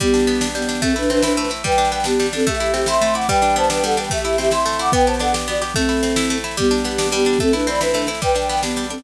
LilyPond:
<<
  \new Staff \with { instrumentName = "Flute" } { \time 6/8 \key g \major \tempo 4. = 146 <b g'>2 <b g'>4 | <c' a'>8 <d' b'>8 <d' b'>8 <d' b'>4 r8 | <b' g''>4 <b' g''>8 <b g'>4 <c' a'>8 | <g' e''>4 <g' e''>8 <e'' c'''>4 <fis'' d'''>8 |
<b' g''>4 <c'' a''>8 <b' g''>8 <a' fis''>8 <b' g''>8 | <g' e''>4 <g' e''>8 <e'' c'''>4 <fis'' d'''>8 | <b' g''>8 <c'' a''>8 <a' fis''>8 r8 <fis' d''>8 r8 | <c' a'>2~ <c' a'>8 r8 |
<b g'>2 <b g'>4 | <c' a'>8 <d' b'>8 <d'' b''>8 <d' b'>4 r8 | <b' g''>4 <b' g''>8 <b g'>4 <c' a'>8 | }
  \new Staff \with { instrumentName = "Orchestral Harp" } { \time 6/8 \key g \major g8 d'8 b8 d'8 g8 d'8 | a8 e'8 c'8 e'8 a8 e'8 | g8 d'8 b8 d'8 g8 d'8 | a8 e'8 c'8 e'8 a8 e'8 |
g8 d'8 b8 d'8 g8 d'8 | a8 e'8 c'8 e'8 a8 e'8 | b8 g'8 d'8 g'8 b8 g'8 | a8 e'8 c'8 e'8 a8 e'8 |
g8 d'8 b8 d'8 g8 d'8 | a8 e'8 c'8 e'8 a8 e'8 | g8 d'8 b8 d'8 g8 d'8 | }
  \new DrumStaff \with { instrumentName = "Drums" } \drummode { \time 6/8 <bd sn>16 sn16 sn16 sn16 sn16 sn16 sn16 sn16 sn16 sn16 sn16 sn16 | <bd sn>16 sn16 sn16 sn16 sn16 sn16 sn16 sn16 sn16 sn16 sn16 sn16 | <bd sn>16 sn16 sn16 sn16 sn16 sn16 sn16 sn16 sn16 sn16 sn16 sn16 | <bd sn>16 sn16 sn16 sn16 sn16 sn16 sn16 sn16 sn16 sn16 sn16 sn16 |
<bd sn>16 sn16 sn16 sn16 sn16 sn16 sn16 sn16 sn16 sn16 sn16 sn16 | <bd sn>16 sn16 sn16 sn16 sn16 sn16 sn16 sn16 sn16 sn16 sn16 sn16 | <bd sn>16 sn16 sn16 sn16 sn16 sn16 sn16 sn16 sn16 sn16 sn16 sn16 | <bd sn>16 sn16 sn16 sn16 sn16 sn16 sn16 sn16 sn16 sn16 sn16 sn16 |
<bd sn>16 sn16 sn16 sn16 sn16 sn16 sn16 sn16 sn16 sn16 sn16 sn16 | <bd sn>16 sn16 sn16 sn16 sn16 sn16 sn16 sn16 sn16 sn16 sn16 sn16 | <bd sn>16 sn16 sn16 sn16 sn16 sn16 sn16 sn16 sn16 sn16 sn16 sn16 | }
>>